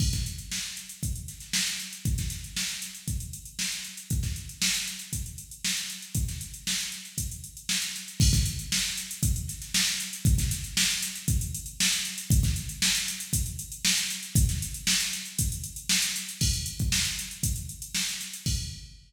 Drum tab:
CC |x---------------|----------------|----------------|----------------|
HH |-xxx--xxxxxx-xxx|xxxx-xxxxxxx-xxx|xxxx-xxxxxxx-xxx|xxxx-xxxxxxx-xxx|
SD |-o--oo----ooo---|-oo-o-o-----oo--|-o--o-------o-o-|-o--oo------o---|
BD |oo------o-------|oo------o-------|oo------o-------|o-------o-------|

CC |x---------------|----------------|----------------|----------------|
HH |-xxx--xxxxxx-xxx|xxxx-xxxxxxx-xxx|xxxx-xxxxxxx-xxx|xxxx-xxxxxxx-xxx|
SD |-o--oo----ooo---|-oo-o-o-----oo--|-o--o-------o-o-|-o--oo------o---|
BD |oo------o-------|oo------o-------|oo------o-------|o-------o-------|

CC |x---------------|x---------------|
HH |-xxx-xxxxxxx-xxx|----------------|
SD |----o-------o-o-|----------------|
BD |o--o----o-------|o---------------|